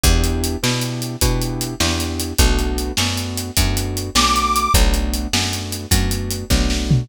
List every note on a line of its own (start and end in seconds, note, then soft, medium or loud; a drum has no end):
0.04 0.56 E2 medium
0.04 0.57 B3 medium
0.04 0.57 D4 medium
0.04 0.57 E4 medium
0.04 0.57 G4 medium
0.04 kick loud
0.04 closed hi-hat medium
0.24 closed hi-hat medium
0.44 closed hi-hat medium
0.63 1.17 B2 medium
0.63 1.16 B3 medium
0.63 1.16 D4 medium
0.63 1.16 E4 medium
0.63 1.16 G4 medium
0.63 snare loud
0.82 closed hi-hat medium
1.02 closed hi-hat medium
1.21 1.75 B2 medium
1.21 1.74 B3 medium
1.21 1.74 D4 medium
1.21 1.74 E4 medium
1.21 1.74 G4 medium
1.21 kick medium
1.21 closed hi-hat loud
1.42 closed hi-hat medium
1.61 closed hi-hat medium
1.80 2.33 E2 medium
1.80 2.33 B3 medium
1.80 2.33 D4 medium
1.80 2.33 E4 medium
1.80 2.33 G4 medium
1.80 snare loud
2.00 closed hi-hat medium
2.20 closed hi-hat medium
2.38 2.92 B1 medium
2.38 2.92 A3 medium
2.38 2.92 B3 medium
2.38 2.92 D4 medium
2.38 2.92 F#4 medium
2.38 kick loud
2.38 closed hi-hat loud
2.59 closed hi-hat medium
2.78 closed hi-hat medium
2.97 3.51 F#2 medium
2.97 3.51 A3 medium
2.97 3.51 B3 medium
2.97 3.51 D4 medium
2.97 3.51 F#4 medium
2.97 snare loud
3.17 closed hi-hat medium
3.38 closed hi-hat medium
3.57 4.10 F#2 medium
3.57 4.10 A3 medium
3.57 4.10 B3 medium
3.57 4.10 D4 medium
3.57 4.10 F#4 medium
3.57 kick medium
3.57 closed hi-hat loud
3.77 closed hi-hat medium
3.97 closed hi-hat medium
4.15 4.68 B1 medium
4.15 4.69 A3 medium
4.15 4.69 B3 medium
4.15 4.69 D4 medium
4.15 4.69 F#4 medium
4.15 4.73 D6 medium
4.15 snare loud
4.36 closed hi-hat medium
4.56 closed hi-hat medium
4.74 5.27 B1 medium
4.74 5.27 A3 medium
4.74 5.27 B3 medium
4.74 5.27 D4 medium
4.74 5.27 F#4 medium
4.74 kick loud
4.74 closed hi-hat loud
4.94 closed hi-hat medium
5.14 closed hi-hat medium
5.33 5.86 F#2 medium
5.33 5.86 A3 medium
5.33 5.86 B3 medium
5.33 5.86 D4 medium
5.33 5.86 F#4 medium
5.33 snare loud
5.53 closed hi-hat medium
5.72 closed hi-hat medium
5.91 6.44 F#2 medium
5.91 6.45 A3 medium
5.91 6.45 B3 medium
5.91 6.45 D4 medium
5.91 6.45 F#4 medium
5.91 kick medium
5.91 closed hi-hat loud
6.11 closed hi-hat medium
6.31 closed hi-hat medium
6.50 7.03 B1 medium
6.50 7.04 A3 medium
6.50 7.04 B3 medium
6.50 7.04 D4 medium
6.50 7.04 F#4 medium
6.50 kick medium
6.50 snare medium
6.70 snare medium
6.91 floor tom loud